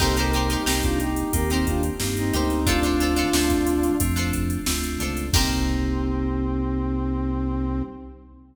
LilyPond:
<<
  \new Staff \with { instrumentName = "Brass Section" } { \time 4/4 \key c \dorian \tempo 4 = 90 <a' c''>16 <g' bes'>8 <ees' g'>16 r16 <d' f'>16 <ees' g'>8 <g' bes'>16 <c' ees'>16 <d' f'>16 r8 <c' ees'>16 <c' ees'>8 | <d' f'>2 r2 | c'1 | }
  \new Staff \with { instrumentName = "Pizzicato Strings" } { \time 4/4 \key c \dorian <ees' g' bes' c''>16 <ees' g' bes' c''>16 <ees' g' bes' c''>16 <ees' g' bes' c''>16 <ees' g' bes' c''>4~ <ees' g' bes' c''>16 <ees' g' bes' c''>4~ <ees' g' bes' c''>16 <ees' g' bes' c''>8 | <d' f' a' c''>16 <d' f' a' c''>16 <d' f' a' c''>16 <d' f' a' c''>16 <d' f' a' c''>4~ <d' f' a' c''>16 <d' f' a' c''>4~ <d' f' a' c''>16 <d' f' a' c''>8 | <ees' g' bes' c''>1 | }
  \new Staff \with { instrumentName = "Electric Piano 2" } { \time 4/4 \key c \dorian <bes c' ees' g'>4 <bes c' ees' g'>4 <bes c' ees' g'>4 <bes c' ees' g'>4 | <a c' d' f'>4 <a c' d' f'>4 <a c' d' f'>4 <a c' d' f'>4 | <bes c' ees' g'>1 | }
  \new Staff \with { instrumentName = "Synth Bass 1" } { \clef bass \time 4/4 \key c \dorian c,4 c,4 ees,4 g,8 d,8~ | d,4 d,4 f,4 d,8 des,8 | c,1 | }
  \new DrumStaff \with { instrumentName = "Drums" } \drummode { \time 4/4 <cymc bd>16 hh16 hh16 hh16 sn16 <hh bd>16 hh16 hh16 <hh bd>16 hh16 <hh bd>16 hh16 sn16 hh16 hh16 <hh sn>16 | <hh bd>16 hh16 hh16 hh16 sn16 <hh bd sn>16 hh16 hh16 <hh bd>16 hh16 <hh bd>16 hh16 sn16 hh16 hh16 <hh sn>16 | <cymc bd>4 r4 r4 r4 | }
>>